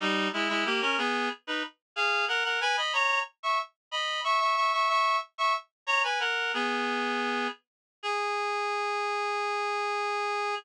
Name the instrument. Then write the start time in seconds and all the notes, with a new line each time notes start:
clarinet
0.01 G3 D#4
0.33 G#3 E4
0.49 G#3 E4
0.65 A#3 G4
0.81 C#4 A#4
0.98 B3 G#4
1.47 D#4 B4
1.96 G#4 F5
2.28 A#4 F#5
2.44 A#4 F#5
2.61 B4 G#5
2.77 D#5 B5
2.93 C#5 A#5
3.43 E5 C#6
3.91 D#5 B5
4.24 E5 C#6
4.40 E5 C#6
4.56 E5 C#6
4.73 E5 C#6
4.89 E5 C#6
5.38 E5 C#6
5.87 C#5 A#5
6.04 B4 G#5
6.20 A#4 F#5
6.54 B3 G#4
8.03 G#4